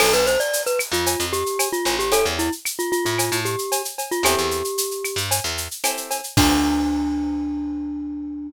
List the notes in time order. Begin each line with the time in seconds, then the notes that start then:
0.00 B1 B3 D4 F4 A4, crash, cowbell, claves
0.13 B1 B4, shaker
0.27 C5, shaker
0.40 D5, shaker
0.53 shaker
0.66 B4, shaker
0.79 claves, shaker
0.92 F2 F4, shaker
1.06 cowbell, shaker
1.19 F2, shaker
1.33 G4, shaker
1.46 shaker
1.59 cowbell, claves, shaker
1.73 F4, shaker
1.85 A1, cowbell, shaker
1.99 G4, shaker
2.12 C#4 E4 G4 A4, cowbell, shaker
2.25 E2, shaker
2.39 E4, shaker
2.52 shaker
2.65 claves, shaker
2.79 F4, shaker
2.92 F4, shaker
3.05 A2 F4, shaker
3.18 cowbell, claves, shaker
3.32 A2, shaker
3.45 G4, shaker
3.59 shaker
3.72 cowbell, shaker
3.85 shaker
3.98 cowbell, shaker
4.11 F4, shaker
4.23 E2 C4 E4 G4 A4, cowbell, claves, shaker
4.38 E2, shaker
4.51 shaker
4.64 shaker
4.78 shaker
4.91 shaker
5.04 claves, shaker
5.16 G2, shaker
5.31 cowbell, shaker
5.44 E2, shaker
5.58 shaker
5.71 shaker
5.84 C4 E4 G4 A4, cowbell, claves, shaker
5.97 shaker
6.11 cowbell, shaker
6.24 shaker
6.37 D2 C4 D4 F4 A4, kick, crash